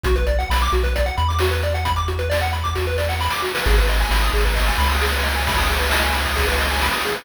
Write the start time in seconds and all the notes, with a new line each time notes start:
0.03 B1 F#4, kick, closed hi-hat
0.16 B4, kick, closed hi-hat
0.27 D5, closed hi-hat
0.39 F#5, closed hi-hat
0.50 B1 B5, snare
0.60 D6, closed hi-hat
0.72 B1 F#4, closed hi-hat
0.83 B4, kick, closed hi-hat
0.96 D5, kick, closed hi-hat
1.06 F#5, closed hi-hat
1.17 E2 B5, closed hi-hat
1.28 D6, closed hi-hat
1.39 F#4, snare
1.51 B4, closed hi-hat
1.63 D5, closed hi-hat
1.74 F#5, closed hi-hat
1.85 B5, kick, closed hi-hat
1.96 D6, closed hi-hat
2.08 F#4, closed hi-hat
2.19 B4, closed hi-hat
2.30 D5, snare
2.41 F#5, closed hi-hat
2.53 B5, closed hi-hat
2.63 D6, kick, closed hi-hat
2.74 F#4, kick, snare
2.87 B4
2.98 D5, snare
3.09 F#5, snare
3.20 B5, snare
3.30 D6, snare
3.42 F#4, snare
3.55 B4, snare
3.65 G#1 G#4, kick, crash
3.76 B4, kick, ride
3.88 D#5, ride
3.98 G#5, ride
4.10 G#1 B5, snare
4.22 D#6, ride
4.33 G#1 G#4, ride
4.44 B4, kick, ride
4.56 D#5, kick, ride
4.66 G#5, ride
4.78 C#2 B5, ride
4.90 D#6, ride
5.01 G#4, snare
5.12 B4, ride
5.23 D#5, ride
5.34 G#5, ride
5.47 B5, kick, ride
5.57 D#6, kick, ride
5.67 G#4, ride
5.79 B4, ride
5.91 D#5, snare
6.03 G#5, ride
6.14 B5, ride
6.25 D#6, kick, ride
6.36 G#4, kick, ride
6.47 B4, ride
6.59 D#5, ride
6.70 G#5, ride
6.81 B5, snare
6.92 D#6, ride
7.04 G#4, ride
7.15 B4, ride